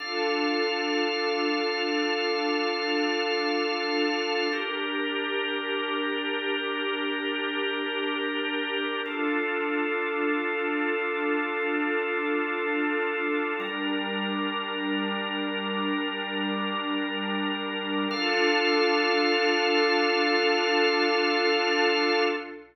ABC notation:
X:1
M:4/4
L:1/8
Q:1/4=53
K:Dm
V:1 name="Pad 2 (warm)"
[DFA]8 | [DGB]8 | [DFA]8 | [G,DB]8 |
[DFA]8 |]
V:2 name="Drawbar Organ"
[DAf]8 | [DGB]8 | [DFA]8 | [G,DB]8 |
[DAf]8 |]